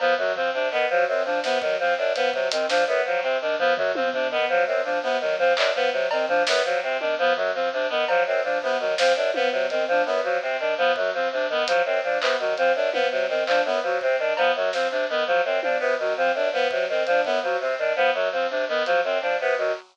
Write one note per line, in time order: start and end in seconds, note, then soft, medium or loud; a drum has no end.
0.00 0.14 F3 medium
0.00 0.14 B3 medium
0.00 cowbell medium
0.18 0.32 F#2 medium
0.18 0.33 F#3 medium
0.18 floor tom medium
0.36 0.50 F3 medium
0.36 0.50 C4 medium
0.36 floor tom medium
0.54 0.68 C3 medium
0.54 0.68 D4 medium
0.72 0.86 D#3 medium
0.72 0.86 B3 medium
0.72 clap medium
0.90 1.04 F3 medium
0.90 1.05 F#3 medium
1.08 1.22 F#2 medium
1.08 1.23 C4 medium
1.25 1.40 F3 medium
1.25 1.39 D4 medium
1.44 1.58 C3 medium
1.44 1.58 B3 medium
1.44 snare medium
1.61 1.76 D#3 medium
1.61 1.76 F#3 medium
1.61 kick loud
1.80 1.94 F3 medium
1.80 1.95 C4 medium
1.98 2.12 F#2 medium
1.98 2.12 D4 medium
2.15 2.30 F3 medium
2.15 2.30 B3 medium
2.15 closed hi-hat medium
2.34 2.48 C3 medium
2.34 2.48 F#3 medium
2.34 kick loud
2.51 2.66 D#3 medium
2.51 2.66 C4 medium
2.51 closed hi-hat loud
2.68 2.84 F3 medium
2.68 2.82 D4 medium
2.68 snare medium
2.87 3.01 F#2 medium
2.87 3.02 B3 medium
3.06 3.20 F3 medium
3.06 3.21 F#3 medium
3.22 3.38 C3 medium
3.22 3.36 C4 medium
3.41 3.56 D#3 medium
3.41 3.56 D4 medium
3.59 3.73 F3 medium
3.59 3.73 B3 medium
3.59 floor tom medium
3.77 3.91 F#2 medium
3.77 3.92 F#3 medium
3.77 floor tom loud
3.95 4.10 F3 medium
3.95 4.09 C4 medium
3.95 high tom loud
4.13 4.27 C3 medium
4.13 4.28 D4 medium
4.13 floor tom medium
4.31 4.45 D#3 medium
4.31 4.46 B3 medium
4.49 4.63 F3 medium
4.49 4.64 F#3 medium
4.67 4.81 F#2 medium
4.67 4.81 C4 medium
4.84 4.99 F3 medium
4.84 4.98 D4 medium
5.03 5.18 C3 medium
5.03 5.17 B3 medium
5.21 5.35 D#3 medium
5.21 5.35 F#3 medium
5.39 5.53 F3 medium
5.39 5.53 C4 medium
5.39 floor tom medium
5.57 5.71 F#2 medium
5.57 5.71 D4 medium
5.57 clap loud
5.75 5.89 F3 medium
5.75 5.90 B3 medium
5.92 6.07 C3 medium
5.92 6.07 F#3 medium
6.11 6.25 D#3 medium
6.11 6.26 C4 medium
6.11 cowbell loud
6.28 6.43 F3 medium
6.28 6.43 D4 medium
6.28 floor tom medium
6.47 6.62 F#2 medium
6.47 6.62 B3 medium
6.47 snare loud
6.64 6.79 F3 medium
6.64 6.80 F#3 medium
6.83 6.97 C3 medium
6.83 6.97 C4 medium
7.00 7.15 D#3 medium
7.00 7.14 D4 medium
7.00 high tom medium
7.19 7.33 F3 medium
7.19 7.33 B3 medium
7.36 7.51 F#2 medium
7.36 7.50 F#3 medium
7.36 floor tom medium
7.54 7.69 F3 medium
7.54 7.69 C4 medium
7.73 7.87 C3 medium
7.73 7.87 D4 medium
7.89 8.05 D#3 medium
7.89 8.04 B3 medium
8.08 8.23 F3 medium
8.08 8.23 F#3 medium
8.08 cowbell loud
8.26 8.41 F#2 medium
8.26 8.41 C4 medium
8.44 8.58 F3 medium
8.44 8.58 D4 medium
8.62 8.77 C3 medium
8.62 8.77 B3 medium
8.62 kick medium
8.79 8.94 D#3 medium
8.79 8.94 F#3 medium
8.98 9.13 F3 medium
8.98 9.13 C4 medium
8.98 snare loud
9.15 9.31 F#2 medium
9.15 9.29 D4 medium
9.34 9.49 F3 medium
9.34 9.49 B3 medium
9.34 high tom medium
9.52 9.66 C3 medium
9.52 9.66 F#3 medium
9.70 9.84 D#3 medium
9.70 9.84 C4 medium
9.70 closed hi-hat medium
9.88 10.02 F3 medium
9.88 10.04 D4 medium
10.06 10.20 F#2 medium
10.06 10.20 B3 medium
10.23 10.38 F3 medium
10.23 10.38 F#3 medium
10.42 10.57 C3 medium
10.42 10.56 C4 medium
10.59 10.74 D#3 medium
10.59 10.74 D4 medium
10.78 10.92 F3 medium
10.78 10.92 B3 medium
10.96 11.10 F#2 medium
10.96 11.12 F#3 medium
10.96 kick loud
11.14 11.28 F3 medium
11.14 11.29 C4 medium
11.32 11.46 C3 medium
11.32 11.47 D4 medium
11.49 11.64 D#3 medium
11.49 11.65 B3 medium
11.49 floor tom medium
11.67 11.82 F3 medium
11.67 11.82 F#3 medium
11.67 closed hi-hat loud
11.85 12.00 F#2 medium
11.85 12.00 C4 medium
12.04 12.18 F3 medium
12.04 12.18 D4 medium
12.21 12.36 C3 medium
12.21 12.35 B3 medium
12.21 clap loud
12.39 12.54 D#3 medium
12.39 12.54 F#3 medium
12.57 12.72 F3 medium
12.57 12.72 C4 medium
12.57 closed hi-hat medium
12.75 12.90 F#2 medium
12.75 12.90 D4 medium
12.92 13.08 F3 medium
12.92 13.07 B3 medium
12.92 high tom medium
13.11 13.26 C3 medium
13.11 13.26 F#3 medium
13.28 13.43 D#3 medium
13.28 13.43 C4 medium
13.47 13.61 F3 medium
13.47 13.62 D4 medium
13.47 clap medium
13.65 13.79 F#2 medium
13.65 13.80 B3 medium
13.65 kick medium
13.83 13.97 F3 medium
13.83 13.98 F#3 medium
14.01 14.16 C3 medium
14.01 14.16 C4 medium
14.01 kick medium
14.19 14.33 D#3 medium
14.19 14.33 D4 medium
14.37 14.51 F3 medium
14.37 14.52 B3 medium
14.37 cowbell loud
14.55 14.70 F#2 medium
14.55 14.71 F#3 medium
14.73 14.87 F3 medium
14.73 14.88 C4 medium
14.73 snare medium
14.91 15.06 C3 medium
14.91 15.05 D4 medium
15.09 15.24 D#3 medium
15.09 15.24 B3 medium
15.27 15.41 F3 medium
15.27 15.41 F#3 medium
15.45 15.59 F#2 medium
15.45 15.60 C4 medium
15.62 15.77 F3 medium
15.62 15.78 D4 medium
15.62 high tom medium
15.79 15.95 C3 medium
15.79 15.94 B3 medium
15.99 16.13 D#3 medium
15.99 16.14 F#3 medium
16.17 16.32 F3 medium
16.17 16.32 C4 medium
16.35 16.49 F#2 medium
16.35 16.50 D4 medium
16.53 16.67 F3 medium
16.53 16.68 B3 medium
16.70 16.85 C3 medium
16.70 16.86 F#3 medium
16.70 kick loud
16.89 17.03 D#3 medium
16.89 17.04 C4 medium
17.06 17.21 F3 medium
17.06 17.22 D4 medium
17.06 closed hi-hat medium
17.25 17.39 F#2 medium
17.25 17.39 B3 medium
17.25 kick medium
17.43 17.57 F3 medium
17.43 17.57 F#3 medium
17.60 17.74 C3 medium
17.60 17.75 C4 medium
17.78 17.93 D#3 medium
17.78 17.93 D4 medium
17.96 18.10 F3 medium
17.96 18.10 B3 medium
18.14 18.29 F#2 medium
18.14 18.29 F#3 medium
18.32 18.46 F3 medium
18.32 18.47 C4 medium
18.50 18.65 C3 medium
18.50 18.64 D4 medium
18.68 18.83 D#3 medium
18.68 18.83 B3 medium
18.85 19.01 F3 medium
18.85 19.00 F#3 medium
18.85 closed hi-hat medium
19.04 19.18 F#2 medium
19.04 19.19 C4 medium
19.04 kick medium
19.21 19.36 F3 medium
19.21 19.35 D4 medium
19.40 19.54 C3 medium
19.40 19.55 B3 medium
19.57 19.72 D#3 medium
19.57 19.72 F#3 medium